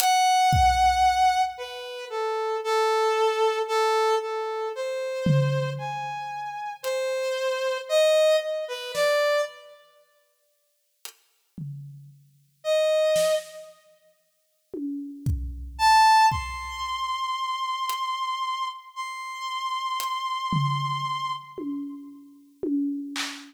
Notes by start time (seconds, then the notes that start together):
0.00 F#5, closed hi-hat
0.53 kick
1.58 B4
2.10 A4
2.64 A4
3.68 A4
4.21 A4
4.75 C5
5.26 floor tom
5.78 G#5
6.83 C5, closed hi-hat
7.89 D#5
8.41 D#5
8.68 B4
8.94 D5, snare
11.05 closed hi-hat
11.58 floor tom
12.64 D#5
13.16 snare
14.74 high tom
15.26 kick
15.79 A5
16.31 C6, kick
17.89 closed hi-hat
18.96 C6
20.00 closed hi-hat
20.53 floor tom
21.58 high tom
22.63 high tom
23.16 clap